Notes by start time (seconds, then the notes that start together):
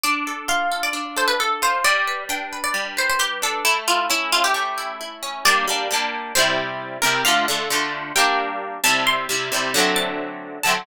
0.03 D4 D5
0.27 A4
0.48 F4 F5
0.72 A4
0.83 D5
0.93 D4
1.17 A4 C5
1.28 B4
1.40 A4
1.62 F4 C5
1.84 G3 D5
2.07 B4
2.29 D4 G5
2.53 B4
2.64 D5
2.74 G3
2.97 B4 C5
3.09 C5
3.19 G4 B4
3.42 D4 A4
3.65 A3 E4
3.88 E4 F4
4.10 C#4 E4
4.32 E4 F4
4.44 G4
4.54 A3
4.78 E4
5.01 E4
5.23 C#4
5.45 G3 A#3 D4 D5
5.68 G3 A#3 D4
5.91 G3 A#3 D4
6.35 C3 G3 E4 C5
7.02 C3 G3 E4 A#4
7.25 D3 A3 F4 F5
7.48 D3 A3 F4
7.70 D3 A3 F4
8.16 G3 A#3 D4 G5
8.84 C3 G3 E4 A5
9.07 C6
9.29 C3 G3 E4
9.52 C3 G3 E4
9.74 D3 F#3 A3
9.78 C4
9.96 A5
10.63 D3 F#3 A3 A5
10.68 C4